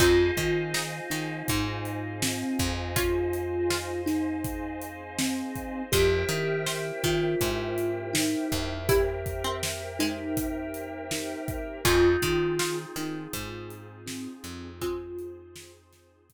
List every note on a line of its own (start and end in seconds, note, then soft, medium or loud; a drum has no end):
0.00 0.31 F2 loud
0.00 0.66 C4 medium
0.00 2.93 C4 medium
0.00 0.66 D#4 medium
0.00 2.93 D#4 medium
0.00 1.08 F4 medium
0.00 2.93 F4 loud
0.00 2.93 G#4 medium
0.00 5.81 C5 medium
0.00 5.81 D#5 medium
0.00 5.81 F5 medium
0.00 5.81 G#5 medium
0.00 kick loud
0.00 closed hi-hat loud
0.37 1.00 D#3 loud
0.37 kick medium
0.37 closed hi-hat medium
0.74 2.11 D#4 medium
0.74 snare loud
1.10 1.43 D#3 medium
1.10 2.18 D#4 medium
1.10 snare medium
1.10 closed hi-hat medium
1.48 2.44 G#2 loud
1.48 kick medium
1.48 closed hi-hat loud
1.85 closed hi-hat medium
2.22 2.92 C4 loud
2.22 snare loud
2.59 5.43 F2 medium
2.59 kick medium
2.59 closed hi-hat medium
2.96 5.89 C4 medium
2.96 3.61 C#4 medium
2.96 5.89 D#4 medium
2.96 3.61 F4 medium
2.96 4.01 F4 loud
2.96 5.89 G#4 medium
2.96 5.89 C5 medium
2.96 kick loud
2.96 closed hi-hat loud
3.33 closed hi-hat medium
3.70 5.11 F4 medium
3.70 snare loud
4.06 5.01 D#4 medium
4.06 snare medium
4.06 closed hi-hat medium
4.44 kick medium
4.44 closed hi-hat medium
4.81 closed hi-hat medium
5.19 5.82 C4 loud
5.19 snare loud
5.56 kick medium
5.56 closed hi-hat medium
5.92 6.25 F2 loud
5.92 8.86 A#3 medium
5.92 8.86 C4 medium
5.92 8.86 E4 medium
5.92 7.01 G4 loud
5.92 8.86 G4 medium
5.92 6.56 G#4 medium
5.92 11.73 A#4 medium
5.92 11.73 C5 medium
5.92 6.56 C5 medium
5.92 11.73 E5 medium
5.92 11.73 G5 medium
5.92 kick loud
5.92 closed hi-hat loud
6.29 6.92 D#3 loud
6.29 closed hi-hat medium
6.67 8.00 C5 medium
6.67 snare loud
7.03 7.35 D#3 loud
7.03 8.09 F4 loud
7.03 kick medium
7.03 snare medium
7.03 closed hi-hat medium
7.41 8.35 G#2 medium
7.41 kick medium
7.41 closed hi-hat loud
7.78 closed hi-hat medium
8.13 8.77 D#4 medium
8.13 snare loud
8.52 11.35 F2 medium
8.52 kick medium
8.52 closed hi-hat medium
8.89 11.82 A#3 medium
8.89 11.82 C4 medium
8.89 9.35 E4 medium
8.89 9.82 G4 loud
8.89 11.82 G4 medium
8.89 11.82 A#4 medium
8.89 kick loud
8.89 closed hi-hat loud
9.26 kick medium
9.26 closed hi-hat medium
9.44 9.94 C4 medium
9.63 snare loud
9.99 11.23 G#3 medium
9.99 11.03 D#4 medium
9.99 snare medium
9.99 closed hi-hat medium
10.37 kick medium
10.37 closed hi-hat loud
10.74 closed hi-hat medium
11.11 11.78 D#4 medium
11.11 snare loud
11.48 kick medium
11.48 closed hi-hat medium
11.85 12.17 F2 loud
11.85 14.78 C4 medium
11.85 16.33 C4 medium
11.85 12.51 C#4 medium
11.85 14.78 D#4 medium
11.85 16.33 D#4 medium
11.85 14.78 F4 medium
11.85 12.77 F4 loud
11.85 12.51 F4 medium
11.85 16.33 F4 medium
11.85 14.78 G#4 medium
11.85 16.33 G#4 medium
11.85 kick loud
11.85 closed hi-hat loud
12.22 12.85 D#3 loud
12.22 kick medium
12.22 closed hi-hat medium
12.59 14.02 F4 medium
12.59 snare loud
12.96 13.27 D#3 loud
12.96 14.01 D#4 loud
12.96 snare medium
12.96 closed hi-hat medium
13.33 14.28 G#2 loud
13.33 kick medium
13.33 closed hi-hat loud
13.70 closed hi-hat medium
14.06 14.69 C4 medium
14.06 snare loud
14.44 16.33 F2 loud
14.44 closed hi-hat medium
14.81 15.74 G#3 medium
14.81 15.74 C4 medium
14.81 16.33 C4 medium
14.81 16.33 D#4 medium
14.81 15.71 F4 loud
14.81 16.33 G#4 medium
14.81 16.33 C5 medium
14.81 kick loud
14.81 closed hi-hat loud
15.19 closed hi-hat medium
15.56 snare loud
15.93 snare medium
15.93 closed hi-hat medium
16.30 kick medium
16.30 closed hi-hat loud